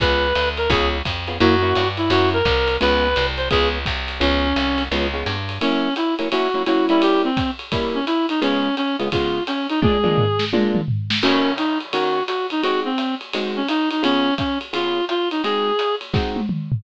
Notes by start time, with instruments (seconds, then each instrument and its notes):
0.00 electric bass (finger) C#2, acoustic guitar (steel) B3 C#4 F4 G#4, clarinet B4, kick, ride
0.35 electric bass (finger) D2, hi-hat pedal, ride
0.57 clarinet A#4, ride
0.70 electric bass (finger) C#2, acoustic guitar (steel) B3 C#4 F4 G#4, clarinet G#4, kick, ride
1.05 electric bass (finger) F2, kick, hi-hat pedal, ride
1.27 acoustic guitar (steel) B3 C#4 F4 G#4, ride
1.40 electric bass (finger) F#2, acoustic guitar (steel) A#3 C#4 E4 F#4, clarinet F#4, ride
1.62 acoustic guitar (steel) A#3 C#4 E4 F#4
1.75 electric bass (finger) G2, hi-hat pedal, ride
1.97 clarinet E4, ride
2.10 electric bass (finger) F#2, acoustic guitar (steel) A#3 C#4 E4 F#4, clarinet F#4, ride
2.33 clarinet A#4
2.45 electric bass (finger) C2, kick, hi-hat pedal, ride
2.68 ride
2.81 electric bass (finger) C#2, acoustic guitar (steel) G#3 B3 C#4 F4, clarinet B4, ride
3.16 electric bass (finger) C2, hi-hat pedal, ride
3.37 clarinet C5, ride
3.50 electric bass (finger) C#2, acoustic guitar (steel) G#3 B3 C#4 F4, clarinet G#4, kick, ride
3.86 electric bass (finger) C2, kick, hi-hat pedal, ride
4.08 ride
4.20 electric bass (finger) C#2, acoustic guitar (steel) G#3 B3 C#4 F4, clarinet C#4, ride
4.56 electric bass (finger) C2, hi-hat pedal, ride
4.78 ride
4.92 electric bass (finger) C#2, acoustic guitar (steel) G#3 B3 C#4 F4, ride
5.14 acoustic guitar (steel) G#3 B3 C#4 F4
5.26 electric bass (finger) G2, hi-hat pedal, ride
5.49 ride
5.61 acoustic guitar (steel) F#3 A#3 C#4 E4, clarinet C#4, ride
5.96 clarinet E4, hi-hat pedal, ride
6.19 acoustic guitar (steel) F#3 A#3 C#4 E4, ride
6.31 acoustic guitar (steel) F#3 A#3 C#4 E4, clarinet F#4, ride
6.54 acoustic guitar (steel) F#3 A#3 C#4 E4
6.66 acoustic guitar (steel) F#3 A#3 C#4 E4, clarinet F#4, hi-hat pedal, ride
6.89 acoustic guitar (steel) G3 A#3 C#4 E4, clarinet E4, ride
7.02 clarinet G4, ride
7.24 clarinet C4
7.37 kick, hi-hat pedal, ride
7.59 ride
7.72 acoustic guitar (steel) G3 A#3 C#4 E4, kick, ride
7.95 clarinet C#4
8.06 clarinet E4, hi-hat pedal, ride
8.29 clarinet D#4, ride
8.42 acoustic guitar (steel) C#3 G#3 B3 F4, clarinet C#4, ride
8.77 clarinet C#4, hi-hat pedal, ride
8.99 acoustic guitar (steel) C#3 G#3 B3 F4, ride
9.12 acoustic guitar (steel) C#3 G#3 B3 F4, clarinet F4, kick, ride
9.47 clarinet C#4, hi-hat pedal, ride
9.69 clarinet D#4, ride
9.82 acoustic guitar (steel) A#2 G#3 D4 F4, clarinet G#4, kick, high tom
10.04 acoustic guitar (steel) A#2 G#3 D4 F4, mid tom
10.18 floor tom
10.39 snare
10.53 acoustic guitar (steel) A#2 G#3 D4 F4, high tom
10.75 mid tom
10.88 floor tom
11.10 snare
11.23 acoustic guitar (steel) D#3 A#3 C#4 F#4, clarinet C#4, crash, ride
11.58 clarinet D#4, hi-hat pedal, ride
11.80 ride
11.93 acoustic guitar (steel) D#3 A#3 C#4 F#4, clarinet F#4, ride
12.27 clarinet F#4, hi-hat pedal, ride
12.50 clarinet D#4, ride
12.62 acoustic guitar (steel) G#3 C4 D#4 F#4, clarinet F#4, ride
12.85 clarinet C4
12.98 hi-hat pedal, ride
13.21 ride
13.33 acoustic guitar (steel) G#3 C4 D#4 F#4, ride
13.56 clarinet C#4
13.68 clarinet D#4, hi-hat pedal, ride
13.91 clarinet D#4, ride
14.03 acoustic guitar (steel) C#3 B3 F4 G#4, clarinet C#4, ride
14.38 clarinet C#4, kick, hi-hat pedal, ride
14.61 ride
14.73 acoustic guitar (steel) C#3 B3 F4 G#4, clarinet F4, ride
15.09 clarinet F4, hi-hat pedal, ride
15.31 clarinet D#4, ride
15.43 acoustic guitar (steel) G#3 C4 D#4 F#4, clarinet G#4, ride
15.79 hi-hat pedal, ride
16.01 ride
16.14 acoustic guitar (steel) G#3 C4 D#4 F#4, kick, snare
16.36 high tom
16.49 mid tom
16.72 floor tom